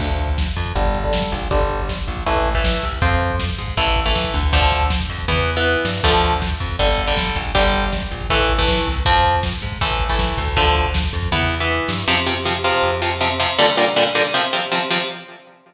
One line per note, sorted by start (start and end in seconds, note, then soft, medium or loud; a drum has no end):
0.00 0.48 D2 loud
0.00 0.30 D3 medium
0.00 0.30 F3 medium
0.00 0.30 A3 medium
0.00 kick loud
0.00 crash loud
0.09 kick medium
0.18 kick medium
0.18 closed hi-hat medium
0.28 kick medium
0.38 kick loud
0.38 snare loud
0.47 kick medium
0.56 0.73 F2 loud
0.56 kick medium
0.56 closed hi-hat medium
0.65 kick medium
0.75 1.24 G1 loud
0.75 0.98 D3 medium
0.75 0.98 G3 medium
0.75 kick medium
0.75 closed hi-hat loud
0.85 kick medium
0.95 kick medium
0.95 closed hi-hat medium
1.04 1.34 D3 medium
1.04 1.34 G3 medium
1.04 kick medium
1.13 kick medium
1.13 snare loud
1.22 kick medium
1.32 1.48 A#1 loud
1.32 kick medium
1.32 closed hi-hat medium
1.42 kick medium
1.51 1.99 G1 loud
1.51 1.81 D3 medium
1.51 1.81 G3 loud
1.51 kick loud
1.51 closed hi-hat loud
1.60 kick medium
1.70 kick medium
1.70 closed hi-hat medium
1.79 kick medium
1.89 kick medium
1.89 snare loud
1.98 kick medium
2.07 2.24 A#1 medium
2.07 kick medium
2.07 closed hi-hat medium
2.17 kick medium
2.26 2.75 A1 loud
2.26 2.49 E3 loud
2.26 2.49 A3 medium
2.26 kick loud
2.26 closed hi-hat loud
2.36 kick medium
2.45 kick medium
2.45 closed hi-hat medium
2.55 2.85 E3 medium
2.55 2.85 A3 medium
2.55 kick loud
2.64 kick medium
2.64 snare loud
2.74 kick medium
2.83 2.99 C2 medium
2.83 kick medium
2.83 closed hi-hat medium
2.93 kick medium
3.01 3.50 F2 loud
3.01 3.32 F3 medium
3.01 3.32 C4 medium
3.01 kick loud
3.01 closed hi-hat loud
3.11 kick medium
3.21 kick medium
3.21 closed hi-hat medium
3.30 kick medium
3.40 kick medium
3.40 snare loud
3.49 kick medium
3.58 3.75 G#2 medium
3.58 kick medium
3.58 closed hi-hat medium
3.68 kick medium
3.77 4.25 A1 loud
3.77 4.00 E3 medium
3.77 4.00 A3 medium
3.77 kick loud
3.77 closed hi-hat loud
3.87 kick medium
3.96 kick loud
3.96 closed hi-hat medium
4.06 4.36 E3 medium
4.06 4.36 A3 medium
4.06 kick medium
4.15 kick loud
4.15 snare loud
4.24 kick loud
4.34 5.01 D2 loud
4.34 kick medium
4.34 closed hi-hat medium
4.43 kick medium
4.53 4.83 D3 medium
4.53 4.83 F3 medium
4.53 4.83 A3 medium
4.53 kick loud
4.53 closed hi-hat loud
4.62 kick medium
4.72 kick medium
4.72 closed hi-hat medium
4.81 kick medium
4.90 kick loud
4.90 snare loud
5.00 kick medium
5.09 5.26 F2 medium
5.09 kick medium
5.09 closed hi-hat medium
5.19 kick medium
5.28 5.76 E2 loud
5.28 5.51 E3 medium
5.28 5.51 B3 medium
5.28 kick medium
5.28 floor tom medium
5.57 5.87 E3 medium
5.57 5.87 B3 medium
5.85 6.01 G2 loud
5.85 snare loud
6.03 6.52 D2 loud
6.03 6.34 D3 medium
6.03 6.34 F3 medium
6.03 6.34 A3 medium
6.03 kick loud
6.03 crash loud
6.14 kick medium
6.22 kick medium
6.22 closed hi-hat medium
6.32 kick medium
6.42 kick loud
6.42 snare loud
6.51 kick medium
6.60 6.76 F2 loud
6.60 kick medium
6.60 closed hi-hat medium
6.69 kick medium
6.79 7.27 G1 loud
6.79 7.02 D3 medium
6.79 7.02 G3 medium
6.79 kick medium
6.79 closed hi-hat loud
6.89 kick medium
6.98 kick medium
6.98 closed hi-hat medium
7.07 7.38 D3 medium
7.07 7.38 G3 medium
7.07 kick medium
7.17 kick medium
7.17 snare loud
7.26 kick medium
7.36 7.52 A#1 loud
7.36 kick medium
7.36 closed hi-hat medium
7.45 kick medium
7.55 8.03 G1 loud
7.55 7.85 D3 medium
7.55 7.85 G3 loud
7.55 kick loud
7.55 closed hi-hat loud
7.64 kick medium
7.74 kick medium
7.74 closed hi-hat medium
7.83 kick medium
7.92 kick medium
7.92 snare loud
8.02 kick medium
8.11 8.27 A#1 medium
8.11 kick medium
8.11 closed hi-hat medium
8.21 kick medium
8.30 8.78 A1 loud
8.30 8.53 E3 loud
8.30 8.53 A3 medium
8.30 kick loud
8.30 closed hi-hat loud
8.40 kick medium
8.49 kick medium
8.49 closed hi-hat medium
8.58 8.89 E3 medium
8.58 8.89 A3 medium
8.58 kick loud
8.68 kick medium
8.68 snare loud
8.78 kick medium
8.87 9.03 C2 medium
8.87 kick medium
8.87 closed hi-hat medium
8.96 kick medium
9.05 9.54 F2 loud
9.05 9.36 F3 medium
9.05 9.36 C4 medium
9.05 kick loud
9.05 closed hi-hat loud
9.15 kick medium
9.24 kick medium
9.24 closed hi-hat medium
9.35 kick medium
9.43 kick medium
9.43 snare loud
9.53 kick medium
9.62 9.78 G#2 medium
9.62 kick medium
9.62 closed hi-hat medium
9.72 kick medium
9.81 10.29 A1 loud
9.81 10.04 E3 medium
9.81 10.04 A3 medium
9.81 kick loud
9.81 closed hi-hat loud
9.91 kick medium
10.00 kick loud
10.00 closed hi-hat medium
10.09 10.40 E3 medium
10.09 10.40 A3 medium
10.09 kick medium
10.19 kick loud
10.19 snare loud
10.29 kick loud
10.38 11.05 D2 loud
10.38 kick medium
10.38 closed hi-hat medium
10.47 kick medium
10.57 10.87 D3 medium
10.57 10.87 F3 medium
10.57 10.87 A3 medium
10.57 kick loud
10.57 closed hi-hat loud
10.66 kick medium
10.75 kick medium
10.75 closed hi-hat medium
10.85 kick medium
10.94 kick loud
10.94 snare loud
11.04 kick medium
11.13 11.29 F2 medium
11.13 kick medium
11.13 closed hi-hat medium
11.23 kick medium
11.32 11.80 E2 loud
11.32 11.55 E3 medium
11.32 11.55 B3 medium
11.32 kick medium
11.32 floor tom medium
11.60 11.91 E3 medium
11.60 11.91 B3 medium
11.88 12.05 G2 loud
11.88 snare loud
12.08 12.72 F2 medium
12.08 12.15 C3 loud
12.08 12.15 F3 loud
12.26 12.34 C3 medium
12.26 12.34 F3 medium
12.45 12.53 C3 medium
12.45 12.53 F3 medium
12.64 12.91 C3 medium
12.64 12.91 F3 medium
12.83 13.47 F2 medium
13.02 13.09 C3 medium
13.02 13.09 F3 medium
13.21 13.28 C3 medium
13.21 13.28 F3 medium
13.40 13.47 C3 medium
13.40 13.47 F3 medium
13.58 13.66 A#2 medium
13.58 13.66 D3 medium
13.58 13.66 G3 loud
13.77 13.85 A#2 medium
13.77 13.85 D3 medium
13.77 13.85 G3 medium
13.96 14.04 A#2 medium
13.96 14.04 D3 medium
13.96 14.04 G3 medium
14.15 14.23 A#2 medium
14.15 14.23 D3 medium
14.15 14.23 G3 medium
14.34 14.42 C3 medium
14.34 14.42 F3 loud
14.53 14.60 C3 medium
14.53 14.60 F3 medium
14.72 14.79 C3 medium
14.72 14.79 F3 medium
14.91 14.98 C3 loud
14.91 14.98 F3 medium